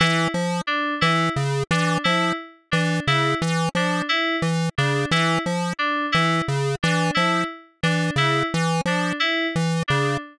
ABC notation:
X:1
M:5/4
L:1/8
Q:1/4=88
K:none
V:1 name="Lead 1 (square)" clef=bass
E, F, z E, ^C, E, F, z E, C, | E, F, z E, ^C, E, F, z E, C, | E, F, z E, ^C, E, F, z E, C, |]
V:2 name="Electric Piano 2"
E z D E z D E z D E | z D E z D E z D E z | D E z D E z D E z D |]